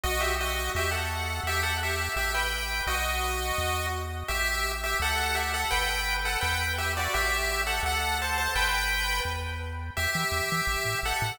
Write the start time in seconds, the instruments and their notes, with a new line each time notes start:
0.03 synth bass 1 B1, lead 1 (square) F#4 D#5
0.21 lead 1 (square) G4 E5
0.41 lead 1 (square) F#4 D#5
0.75 synth bass 1 E2, lead 1 (square) G4 E5
0.91 lead 1 (square) A4 F#5
1.43 synth bass 1 E2, lead 1 (square) G4 E5
1.63 lead 1 (square) A4 F#5
1.83 lead 1 (square) G4 E5
2.16 synth bass 1 A1, lead 1 (square) G4 E5
2.34 lead 1 (square) B4 G5
2.87 synth bass 1 B1, lead 1 (square) F#4 D#5
3.58 synth bass 1 E2
4.28 synth bass 1 A1, lead 1 (square) G4 E5
4.84 lead 1 (square) G4 E5
5.00 synth bass 1 D2, lead 1 (square) A4 F#5
5.35 lead 1 (square) G4 E5
5.54 lead 1 (square) A4 F#5
5.71 synth bass 1 G1, lead 1 (square) B4 G5
6.25 lead 1 (square) A4 F#5
6.41 synth bass 1 E2, lead 1 (square) B4 G5
6.78 lead 1 (square) G4 E5
6.97 lead 1 (square) F#4 D5
7.14 synth bass 1 A1, lead 1 (square) G4 E5
7.67 lead 1 (square) A4 F#5
7.83 synth bass 1 D2, lead 1 (square) A4 F#5
8.22 lead 1 (square) C5 A5
8.38 lead 1 (square) C5 A5
8.55 synth bass 1 G1, lead 1 (square) B4 G5
9.25 synth bass 1 E2
9.97 synth bass 1 E2, lead 1 (square) G4 E5
10.15 synth bass 1 E3
10.32 synth bass 1 E2
10.52 synth bass 1 E3
10.67 synth bass 1 A1
10.85 synth bass 1 A2
11.03 synth bass 1 A1, lead 1 (square) A4 F#5
11.22 synth bass 1 A2